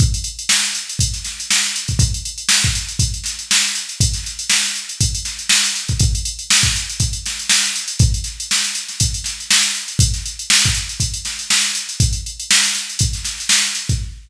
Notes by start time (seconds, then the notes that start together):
0.00 kick, closed hi-hat
0.14 closed hi-hat
0.24 closed hi-hat
0.39 closed hi-hat
0.49 snare
0.64 closed hi-hat
0.75 closed hi-hat
0.89 closed hi-hat
0.99 kick, closed hi-hat
1.14 snare, closed hi-hat
1.24 snare, closed hi-hat
1.40 closed hi-hat
1.51 snare
1.64 closed hi-hat
1.76 closed hi-hat
1.88 kick, closed hi-hat
1.99 kick, closed hi-hat
2.14 closed hi-hat
2.25 closed hi-hat
2.38 closed hi-hat
2.49 snare
2.64 kick, closed hi-hat
2.75 closed hi-hat
2.89 closed hi-hat
2.99 kick, closed hi-hat
3.14 closed hi-hat
3.24 snare, closed hi-hat
3.39 closed hi-hat
3.51 snare
3.64 closed hi-hat
3.75 closed hi-hat
3.89 closed hi-hat
4.00 kick, closed hi-hat
4.14 snare, closed hi-hat
4.24 snare, closed hi-hat
4.39 closed hi-hat
4.50 snare
4.64 snare, closed hi-hat
4.75 closed hi-hat
4.89 closed hi-hat
5.01 kick, closed hi-hat
5.15 closed hi-hat
5.25 snare, closed hi-hat
5.39 closed hi-hat
5.49 snare
5.65 closed hi-hat
5.75 closed hi-hat
5.88 kick, closed hi-hat
5.99 kick, closed hi-hat
6.15 closed hi-hat
6.25 closed hi-hat
6.39 closed hi-hat
6.50 snare
6.63 kick, closed hi-hat
6.76 closed hi-hat
6.89 closed hi-hat
7.00 kick, closed hi-hat
7.13 closed hi-hat
7.26 snare, closed hi-hat
7.39 closed hi-hat
7.49 snare
7.64 closed hi-hat
7.76 closed hi-hat
7.88 closed hi-hat
7.99 kick, closed hi-hat
8.14 closed hi-hat
8.24 snare, closed hi-hat
8.40 closed hi-hat
8.51 snare
8.64 closed hi-hat
8.75 closed hi-hat
8.88 snare, closed hi-hat
9.00 kick, closed hi-hat
9.14 closed hi-hat
9.24 snare, closed hi-hat
9.40 closed hi-hat
9.51 snare
9.63 closed hi-hat
9.75 closed hi-hat
9.88 closed hi-hat
9.99 kick, closed hi-hat
10.14 snare, closed hi-hat
10.26 closed hi-hat
10.39 closed hi-hat
10.50 snare
10.64 kick, closed hi-hat
10.74 closed hi-hat
10.89 closed hi-hat
11.00 kick, closed hi-hat
11.14 closed hi-hat
11.25 snare, closed hi-hat
11.39 closed hi-hat
11.50 snare
11.63 snare, closed hi-hat
11.75 closed hi-hat
11.89 closed hi-hat
12.00 kick, closed hi-hat
12.13 closed hi-hat
12.26 closed hi-hat
12.40 closed hi-hat
12.51 snare
12.64 snare, closed hi-hat
12.75 snare, closed hi-hat
12.89 closed hi-hat
12.99 kick, closed hi-hat
13.13 snare, closed hi-hat
13.25 snare, closed hi-hat
13.38 snare, closed hi-hat
13.49 snare
13.64 closed hi-hat
13.75 closed hi-hat
13.89 kick, closed hi-hat